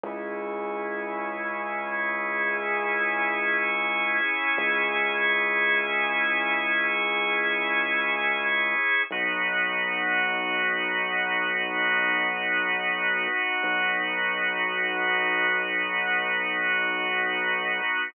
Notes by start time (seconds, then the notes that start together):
0.04 C#2 C#4 E4 G#4
4.58 C#2
9.11 B1 B3 D#4 F#4
13.63 B1